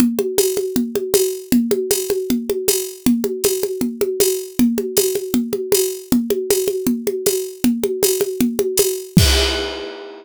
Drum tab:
CC |--------|--------|--------|--------|
TB |--x---x-|--x---x-|--x---x-|--x---x-|
CG |OoooOoo-|OoooOoo-|OoooOoo-|OoooOoo-|
BD |--------|--------|--------|--------|

CC |--------|--------|x-------|
TB |--x---x-|--x---x-|--------|
CG |OoooOoo-|OoooOoo-|--------|
BD |--------|--------|o-------|